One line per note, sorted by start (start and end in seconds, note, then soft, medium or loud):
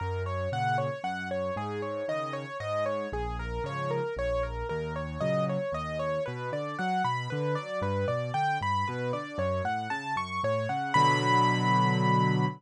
0.00 0.48 F#2 medium
0.00 0.23 A#4 medium
0.26 0.50 C#5 medium
0.52 0.89 A#2 medium
0.52 0.89 C#3 medium
0.52 0.77 F#5 medium
0.78 1.02 C#5 medium
1.04 1.51 F#2 medium
1.04 1.28 F#5 medium
1.31 1.55 C#5 medium
1.56 2.03 G#2 medium
1.56 1.81 G#4 medium
1.82 2.06 C#5 medium
2.08 2.45 C#3 medium
2.08 2.45 D#3 medium
2.08 2.33 D#5 medium
2.33 2.57 C#5 medium
2.60 3.07 G#2 medium
2.60 2.84 D#5 medium
2.86 3.10 C#5 medium
3.12 3.59 A#1 medium
3.12 3.37 G#4 medium
3.39 3.63 A#4 medium
3.64 4.00 G#2 medium
3.64 4.00 C#3 medium
3.64 4.00 F3 medium
3.64 3.90 C#5 medium
3.91 4.15 A#4 medium
4.16 4.63 A#1 medium
4.16 4.43 C#5 medium
4.43 4.67 A#4 medium
4.69 5.18 D#2 medium
4.69 4.93 A#4 medium
4.96 5.20 C#5 medium
5.21 5.58 A#2 medium
5.21 5.58 C#3 medium
5.21 5.58 F#3 medium
5.21 5.45 D#5 medium
5.49 5.73 C#5 medium
5.72 6.19 D#2 medium
5.72 5.98 D#5 medium
5.99 6.23 C#5 medium
6.26 6.51 B2 medium
6.26 6.50 B4 medium
6.52 6.76 D3 medium
6.52 6.77 D5 medium
6.79 7.03 F#3 medium
6.79 7.03 F#5 medium
7.04 7.28 B2 medium
7.04 7.28 B5 medium
7.30 7.56 D3 medium
7.30 7.54 B4 medium
7.55 7.81 F#3 medium
7.55 7.79 D5 medium
7.82 8.05 G2 medium
7.82 8.07 B4 medium
8.08 8.31 B2 medium
8.08 8.32 D5 medium
8.34 8.58 D3 medium
8.34 8.58 G5 medium
8.61 8.85 G2 medium
8.61 8.86 B5 medium
8.87 9.12 B2 medium
8.87 9.12 B4 medium
9.13 9.37 D3 medium
9.13 9.37 D5 medium
9.38 9.61 F#2 medium
9.38 9.63 C#5 medium
9.64 9.87 A2 medium
9.64 9.89 F#5 medium
9.90 10.14 C#3 medium
9.90 10.14 A5 medium
10.16 10.39 F#2 medium
10.16 10.41 C#6 medium
10.43 10.67 A2 medium
10.43 10.68 C#5 medium
10.69 10.93 C#3 medium
10.69 10.93 F#5 medium
10.94 12.46 B2 loud
10.94 12.46 D3 loud
10.94 12.46 F#3 loud
10.94 12.45 B5 loud